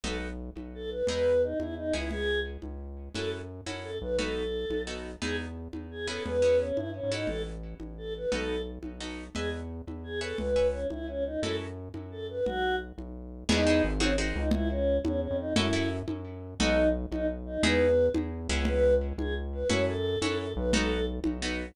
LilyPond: <<
  \new Staff \with { instrumentName = "Choir Aahs" } { \time 6/8 \key e \major \tempo 4. = 116 a'8 r4. a'8 b'8 | b'4 dis'8 e'8 dis'8 e'8 | gis'4 r2 | a'8 r4. a'8 b'8 |
a'2 r4 | gis'8 r4. gis'8 a'8 | b'4 cis'8 e'8 cis'8 dis'8 | a'8 r4. a'8 b'8 |
a'4 r2 | gis'8 r4. gis'8 a'8 | b'4 cis'8 e'8 cis'8 dis'8 | a'8 r4. a'8 b'8 |
fis'4 r2 | dis'4 r8 cis'8 r8 dis'8 | e'8 cis'4 cis'8 cis'8 dis'8 | e'4 r2 |
dis'4 r8 dis'8 r8 dis'8 | b'4. r4. | b'4 r8 gis'8 r8 b'8 | cis''8 a'4 a'8 a'8 b'8 |
a'4 r2 | }
  \new Staff \with { instrumentName = "Acoustic Guitar (steel)" } { \time 6/8 \key e \major <b dis' fis' a'>2. | <b dis' e' gis'>2~ <b dis' e' gis'>8 <b cis' e' gis'>8~ | <b cis' e' gis'>2. | <cis' e' fis' a'>4. <cis' e' fis' a'>4. |
<b dis' fis' a'>2 <b dis' fis' a'>4 | <b dis' e' gis'>2~ <b dis' e' gis'>8 <b cis' e' gis'>8~ | <b cis' e' gis'>8 <b cis' e' gis'>2 <cis' e' fis' a'>8~ | <cis' e' fis' a'>2. |
<b dis' fis' a'>2 <b dis' fis' a'>4 | <b' dis'' e'' gis''>2~ <b' dis'' e'' gis''>8 <b' cis'' e'' gis''>8~ | <b' cis'' e'' gis''>8 <b' cis'' e'' gis''>2~ <b' cis'' e'' gis''>8 | <cis' e' fis' a'>2. |
r2. | <b dis' e' gis'>8 <b dis' e' gis'>4 <bis dis' fis' gis'>8 <bis dis' fis' gis'>4 | r2. | <cis' e' fis' a'>8 <cis' e' fis' a'>2~ <cis' e' fis' a'>8 |
<b dis' fis' a'>2. | <b dis' e' gis'>2~ <b dis' e' gis'>8 <b cis' e' gis'>8~ | <b cis' e' gis'>2. | <cis' e' fis' a'>4. <cis' e' fis' a'>4. |
<b dis' fis' a'>2 <b dis' fis' a'>4 | }
  \new Staff \with { instrumentName = "Synth Bass 1" } { \clef bass \time 6/8 \key e \major b,,4. b,,4. | e,4. e,4 cis,8~ | cis,4. cis,4. | fis,4. fis,4 b,,8~ |
b,,4. b,,4. | e,4. e,4. | e,4. g,8. gis,8. | a,,4. a,,4. |
b,,4. b,,4. | e,4. e,4. | cis,4. cis,4. | fis,4. fis,4. |
b,,4. b,,4. | e,4 gis,,4. cis,8~ | cis,4. e,8. f,8. | fis,4. fis,4. |
b,,4. b,,4. | e,4. e,4 cis,8~ | cis,4. cis,4. | fis,4. fis,4 b,,8~ |
b,,4. b,,4. | }
  \new DrumStaff \with { instrumentName = "Drums" } \drummode { \time 6/8 cgl4. cgho4. | cgl4. cgho4. | cgl4. cgho4. | cgl4. cgho4. |
cgl4. cgho4. | cgl4. cgho4. | cgl4. cgho4. | cgl4. cgho4. |
cgl4. cgho4. | cgl4. cgho4. | cgl4. cgho4. | cgl4. cgho4. |
cgl4. cgho4. | <cgl cymc>4. cgho4. | cgl4. cgho4. | cgl4. cgho4. |
cgl4. cgho4. | cgl4. cgho4. | cgl4. cgho4. | cgl4. cgho4. |
cgl4. cgho4. | }
>>